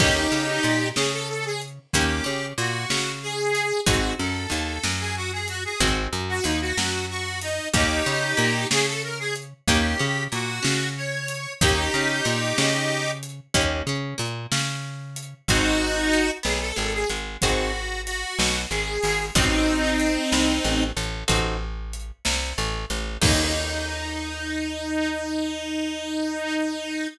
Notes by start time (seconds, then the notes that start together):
0.00 D#2 A#3 C#4 D#4 G4, kick, crash
0.32 C#3 C#4
0.63 A#2 A#3, closed hi-hat
0.96 C#3 C#4 G#4, snare
1.13 A4
1.29 A4
1.45 G#4
1.61 closed hi-hat
1.93 D#2 A#3 C#4 D#4 G4, kick, closed hi-hat
2.24 C#3 C#4
2.58 A#2 A#3 F#4, closed hi-hat
2.90 C#3 C#4, snare
3.23 G#4
3.55 closed hi-hat
3.86 G#1 C4 D#4 F#4 G#4, kick, closed hi-hat
4.19 F#2 F#3 A4
4.50 D#2 D#3, closed hi-hat
4.83 F#2 F#3, snare
5.00 G#4
5.16 F#4
5.32 G#4
5.48 F#4, closed hi-hat
5.65 G#4
5.80 G#1 C4 D#4 F#4 G#4, kick, closed hi-hat
6.13 F#2 F#3
6.29 F#4
6.44 D#2 D#3 D#4, closed hi-hat
6.61 F#4
6.77 F#2 F#3, snare
7.10 F#4
7.41 D#4, closed hi-hat
7.74 D#2 A#3 C#4 D#4 G4, kick, closed hi-hat
8.06 C#3 C#4
8.37 A#2 A#3, closed hi-hat
8.71 C#3 C#4 G#4, snare
8.87 A4
9.03 A#4
9.19 G#4
9.35 closed hi-hat
9.68 D#2 A#3 C#4 D#4 G4, kick, closed hi-hat
9.99 C#3 C#4
10.32 A#2 A#3 F#4, closed hi-hat
10.62 C#3 C#4, snare
10.97 C#5
11.28 closed hi-hat
11.61 D#2 A#3 C#4 D#4 G4, kick, closed hi-hat
11.94 C#3 C#4
12.25 A#2 A#3, closed hi-hat
12.58 C#3 C#4, snare
13.23 closed hi-hat
13.54 D#2 A#3 C#4 D#4 G4, kick, closed hi-hat
13.87 C#3 C#4
14.18 A#2 A#3, closed hi-hat
14.52 C#3 C#4, snare
15.16 closed hi-hat
15.48 G#1 C4 D#4 F#4 G#4, kick, closed hi-hat
16.13 closed hi-hat
16.43 B1 B3 G#4, snare
16.61 A4
16.76 G#1 G#3 A4
16.94 G#4
17.09 G#1 G#3, closed hi-hat
17.42 G#1 C4 D#4 F#4 G#4, kick, closed hi-hat
18.06 F#4, closed hi-hat
18.39 B1 B3, snare
18.71 G#1 G#3 G#4
19.03 G#1 G#3, open hi-hat
19.35 A1 C4 D#4 F#4 A4, kick, closed hi-hat
20.00 closed hi-hat
20.32 C2 C3, snare
20.64 A1 A3
20.97 A1 A3, closed hi-hat
21.28 A1 C4 D#4 F#4 A4, kick, closed hi-hat
21.93 closed hi-hat
22.25 C2 C3, snare
22.58 A1 A3
22.90 A1 A3, closed hi-hat
23.22 D#2 A#3 C#4 D#4 G4, kick, crash